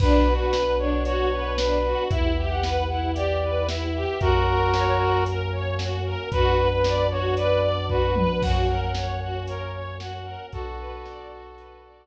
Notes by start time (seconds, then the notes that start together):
0.00 B1 B3 D4 F#4 B4, kick, crash
0.28 F#4
0.39 B4
0.53 B4, snare
0.79 D4 C#5
1.05 F#4 C#5, closed hi-hat
1.33 B4
1.58 D4 B4, snare
1.85 F#4
2.09 E2 B3 E4 G4 E5, kick, closed hi-hat
2.38 G4
2.50 F#5
2.63 B4, snare
2.89 E4 F#5
3.14 G4 D5, closed hi-hat
3.43 B4
3.68 E4 E5, snare
3.94 G4
4.20 F#2 A#3 C#4 F#4 A#4, kick, closed hi-hat
4.47 A#4
4.73 C#5, snare
4.99 F#4
5.26 A#4, closed hi-hat
5.52 C#5
5.79 F#4, snare
6.05 A#4
6.32 F#2 B3 D4 F#4 B4, kick, closed hi-hat
6.57 B4
6.71 B4
6.84 D5, snare
7.11 F#4 C#5
7.36 B4 D5, closed hi-hat
7.61 D5
7.89 F#4 B4, kick
8.16 B4, high tom
8.41 F#2 A#3 C#4 F#4 F#5, kick, crash
8.68 A#4
8.82 F#5
8.95 C#5, snare
9.21 F#4 F#5
9.47 A#4 C#5, closed hi-hat
9.74 C#5
10.00 F#4 F#5, snare
10.25 A#4
10.51 B1 B3 D4 F#4 A4, kick, closed hi-hat
10.78 B4
11.05 D5, snare
11.31 F#4
11.56 B4, closed hi-hat
11.84 D5